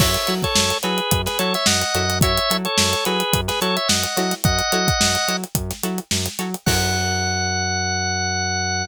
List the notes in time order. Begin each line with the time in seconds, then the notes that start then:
0.00 F#2 E4 F#4 A4 C#5 E5, kick, crash
0.14 closed hi-hat
0.27 F#3 E4 F#4 A4 C#5, closed hi-hat
0.43 A4 C#5, kick, closed hi-hat
0.55 F#2, snare
0.70 closed hi-hat
0.83 F#3 E4 F#4 G#4 A4 B4 C#5, closed hi-hat
0.98 closed hi-hat
1.11 F#2, kick, closed hi-hat
1.26 G#4 B4, snare, closed hi-hat
1.39 F#3 E4 F#4 A4 C#5, closed hi-hat
1.54 C#5 E5, snare, closed hi-hat
1.66 F#2 D#5 F#5, snare
1.81 closed hi-hat
1.95 F#2 E4 F#4 A4 C#5, closed hi-hat
2.10 snare, closed hi-hat
2.21 E4 F#4 A4 C#5 E5, kick, closed hi-hat
2.38 closed hi-hat
2.50 F#3 E4 F#4 A4 C#5, closed hi-hat
2.65 A4 C#5, closed hi-hat
2.78 F#2, snare
2.93 closed hi-hat
3.05 F#3 E4 F#4 G#4 A4 B4 C#5, closed hi-hat
3.20 closed hi-hat
3.33 F#2, kick, closed hi-hat
3.48 G#4 B4, snare, closed hi-hat
3.61 F#3 E4 F#4 A4 C#5, closed hi-hat
3.77 C#5 E5, closed hi-hat
3.88 F#2 D#5 F#5, snare
4.03 closed hi-hat
4.17 F#3 E4 F#4 A4 C#5, snare, closed hi-hat
4.31 snare, closed hi-hat
4.44 F#2 D#5 F#5, kick, closed hi-hat
4.59 closed hi-hat
4.72 F#3 E4 F#4 A4 C#5, closed hi-hat
4.88 kick, closed hi-hat
5.00 F#2, snare
5.15 closed hi-hat
5.28 F#3 E4 F#4 A4 C#5, closed hi-hat
5.44 closed hi-hat
5.55 F#2, kick, closed hi-hat
5.70 snare, closed hi-hat
5.83 F#3 E4 F#4 A4 C#5, closed hi-hat
5.98 closed hi-hat
6.11 F#2, snare
6.26 snare, closed hi-hat
6.39 F#3 E4 F#4 A4 C#5, closed hi-hat
6.54 closed hi-hat
6.66 F#2 E4 F#4 A4 C#5 F#5, kick, crash